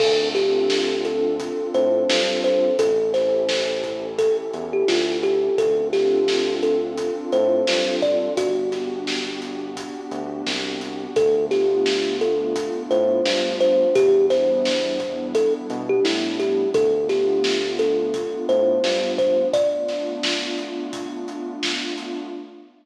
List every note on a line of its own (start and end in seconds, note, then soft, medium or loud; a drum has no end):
0.00 1.49 D2 medium
0.00 2.74 C4 loud
0.00 2.74 D4 loud
0.00 2.74 F4 loud
0.00 0.29 A4 medium
0.00 2.74 A4 loud
0.00 kick loud
0.00 crash loud
0.35 1.02 G4 medium
0.35 snare medium
0.35 closed hi-hat medium
0.70 snare loud
1.05 1.69 A4 medium
1.05 closed hi-hat medium
1.40 kick medium
1.40 closed hi-hat loud
1.74 2.04 A2 medium
1.74 2.41 C5 medium
1.74 closed hi-hat medium
2.10 2.70 G2 medium
2.10 snare loud
2.44 2.77 C5 medium
2.44 closed hi-hat medium
2.79 4.29 A1 medium
2.79 5.53 C#4 loud
2.79 5.53 E4 medium
2.79 5.53 G4 medium
2.79 3.12 A4 medium
2.79 5.53 A4 loud
2.79 kick loud
2.79 closed hi-hat loud
3.14 4.06 C5 medium
3.14 snare medium
3.14 closed hi-hat medium
3.49 snare loud
3.84 kick medium
3.84 closed hi-hat medium
4.18 4.37 A4 medium
4.18 kick medium
4.18 closed hi-hat loud
4.53 4.84 E2 medium
4.53 closed hi-hat medium
4.73 4.88 G4 medium
4.88 5.49 D2 medium
4.88 5.18 F4 medium
4.88 snare loud
5.23 5.56 G4 medium
5.23 closed hi-hat medium
5.58 7.07 D2 medium
5.58 8.32 C4 loud
5.58 8.32 D4 loud
5.58 8.32 F4 loud
5.58 8.32 A4 medium
5.58 5.88 A4 medium
5.58 kick loud
5.58 closed hi-hat loud
5.93 6.54 G4 medium
5.93 snare medium
5.93 closed hi-hat medium
6.28 snare loud
6.63 7.25 A4 medium
6.63 closed hi-hat medium
6.98 kick medium
6.98 closed hi-hat loud
7.32 7.63 A2 medium
7.32 7.95 C5 medium
7.32 closed hi-hat medium
7.67 8.28 G2 medium
7.67 snare loud
8.02 8.34 D5 medium
8.02 kick medium
8.02 closed hi-hat medium
8.37 9.86 G1 medium
8.37 11.11 B3 medium
8.37 11.11 D4 loud
8.37 11.11 F#4 loud
8.37 10.05 F#4 medium
8.37 11.11 G4 loud
8.37 kick medium
8.37 closed hi-hat loud
8.72 snare medium
8.72 closed hi-hat medium
9.07 snare loud
9.42 closed hi-hat medium
9.77 kick medium
9.77 closed hi-hat loud
10.11 10.42 D2 medium
10.11 closed hi-hat medium
10.47 11.07 C2 medium
10.47 snare loud
10.81 closed hi-hat medium
11.16 12.66 D2 medium
11.16 13.90 A3 loud
11.16 13.90 B3 loud
11.16 13.90 D4 medium
11.16 13.90 F4 loud
11.16 11.45 A4 medium
11.16 kick loud
11.16 closed hi-hat loud
11.51 12.17 G4 medium
11.51 snare medium
11.51 closed hi-hat medium
11.86 snare loud
12.21 12.82 A4 medium
12.21 closed hi-hat medium
12.56 kick medium
12.56 closed hi-hat loud
12.91 13.21 A2 medium
12.91 13.56 C5 medium
12.91 closed hi-hat medium
13.26 13.86 G2 medium
13.26 snare loud
13.60 13.95 C5 medium
13.60 closed hi-hat medium
13.95 15.45 E2 medium
13.95 16.69 G3 loud
13.95 16.69 B3 loud
13.95 16.69 D4 loud
13.95 16.69 E4 medium
13.95 14.26 G4 loud
13.95 kick loud
13.95 closed hi-hat loud
14.30 15.27 C5 medium
14.30 snare medium
14.30 closed hi-hat medium
14.65 snare loud
15.00 kick medium
15.00 closed hi-hat medium
15.35 15.53 A4 medium
15.35 kick medium
15.35 closed hi-hat loud
15.70 16.00 B2 medium
15.70 closed hi-hat medium
15.89 16.04 G4 medium
16.05 16.65 A2 medium
16.05 16.36 E4 medium
16.05 snare loud
16.40 16.69 G4 medium
16.40 closed hi-hat medium
16.74 18.24 D2 medium
16.74 19.49 A3 medium
16.74 19.49 B3 loud
16.74 19.49 D4 loud
16.74 19.49 F4 loud
16.74 17.08 A4 medium
16.74 kick loud
16.74 closed hi-hat loud
17.09 17.72 G4 medium
17.09 snare medium
17.09 closed hi-hat medium
17.44 snare loud
17.79 18.46 A4 medium
17.79 snare soft
17.79 closed hi-hat medium
18.14 kick medium
18.14 closed hi-hat loud
18.49 18.79 A2 medium
18.49 19.12 C5 medium
18.49 closed hi-hat medium
18.84 19.44 G2 medium
18.84 snare loud
19.18 19.48 C5 medium
19.18 kick medium
19.18 closed hi-hat medium
19.53 22.28 A3 loud
19.53 22.28 B3 medium
19.53 22.28 D4 loud
19.53 22.28 F4 loud
19.53 20.79 D5 medium
19.53 kick loud
19.53 closed hi-hat loud
19.88 snare medium
19.88 closed hi-hat medium
20.23 snare loud
20.58 closed hi-hat medium
20.93 kick medium
20.93 closed hi-hat loud
21.28 closed hi-hat medium
21.63 snare loud
21.98 closed hi-hat medium